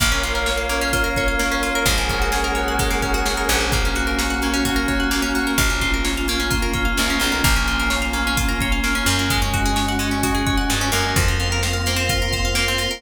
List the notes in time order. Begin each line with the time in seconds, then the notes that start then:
0.00 A#1 A#3 A#4 C#5 F5, kick, closed hi-hat
0.12 C#4
0.23 F4, closed hi-hat
0.35 A#4
0.46 A#3 C#5, snare
0.57 F5
0.69 A#3 C#4, closed hi-hat
0.81 C#4
0.93 A#3 F4, kick, closed hi-hat
1.04 A#4
1.16 F4 C#5, kick, closed hi-hat
1.28 F5
1.39 A#3 C#4, snare
1.51 C#4
1.63 A#3 F4, closed hi-hat
1.75 A#4
1.86 A#1 G#3 G#4 A#4 C#5 F#5, kick, closed hi-hat
1.98 A#3
2.09 A#3 C#4, kick, closed hi-hat
2.22 F#4
2.32 C#4 G#4, snare
2.44 A#4
2.55 F#4 C#5, closed hi-hat
2.68 F#5
2.79 G#3, kick, closed hi-hat
2.91 A#3
3.02 A#3 C#4, kick, closed hi-hat
3.14 F#4
3.26 C#4 G#4, snare
3.37 A#4
3.49 A#1 F#4 C#5, closed hi-hat
3.61 F#5
3.71 A#3 C#4 F#4, kick, closed hi-hat
3.85 C#4
3.95 F#4, closed hi-hat
4.07 A#4
4.19 A#3 C#5, snare
4.30 F#5
4.42 A#3 C#4, closed hi-hat
4.54 C#4
4.65 A#3 F#4, kick, closed hi-hat
4.76 A#4
4.88 F#4 C#5, kick, closed hi-hat
5.00 F#5
5.11 A#3 C#4, snare
5.22 C#4
5.35 A#3 F#4, closed hi-hat
5.47 A#4
5.57 A#1 A#3 C#4 F4, kick, closed hi-hat
5.70 C#4
5.81 F4, kick, closed hi-hat
5.94 A#4
6.05 A#3 C#5, snare
6.17 F5
6.28 A#3 C#4, closed hi-hat
6.40 C#4
6.51 A#3 F4, kick, closed hi-hat
6.62 A#4
6.73 F4 C#5, kick, closed hi-hat
6.85 F5
6.97 C2 A#3 C#4, snare
7.10 C#4
7.20 B1 A#3 F4, closed hi-hat
7.32 A#4
7.44 A#1 A#3 C#4 F4, kick, closed hi-hat
7.56 C#4
7.67 F4, closed hi-hat
7.80 A#4
7.90 A#3 C#5, snare
8.02 F5
8.13 A#3 C#4, closed hi-hat
8.27 C#4
8.37 A#3 F4, kick, closed hi-hat
8.49 A#4
8.60 F4 C#5, kick, closed hi-hat
8.72 F5
8.84 A#3 C#4, snare
8.95 C#4
9.06 F#2 A#3 F4, closed hi-hat
9.19 A#4
9.30 G#3 C#4 F#4, kick, closed hi-hat
9.42 C#4
9.53 F#4, kick, closed hi-hat
9.66 G#4
9.76 G#3 C#5, snare
9.88 F#5
9.99 G#3 C#4, closed hi-hat
10.11 C#4
10.23 G#3 F#4, kick, closed hi-hat
10.35 G#4
10.47 F#4 C#5, kick, closed hi-hat
10.57 F#5
10.70 G2 G#3 C#4, snare
10.81 C#4
10.92 F#2 A#3 A#4, open hi-hat
11.16 F2 A#3 C4 F4, kick, closed hi-hat
11.28 C4
11.40 F4 F5, closed hi-hat
11.52 A#4
11.63 A#4 C5, snare
11.73 F5
11.86 A#3 C5, closed hi-hat
11.96 C4
12.09 F4 A#4, kick, closed hi-hat
12.22 A#4
12.32 C5 F5, kick, closed hi-hat
12.45 F5
12.55 A#3 C5, snare
12.68 C4
12.78 F4 A#4, closed hi-hat
12.91 A#4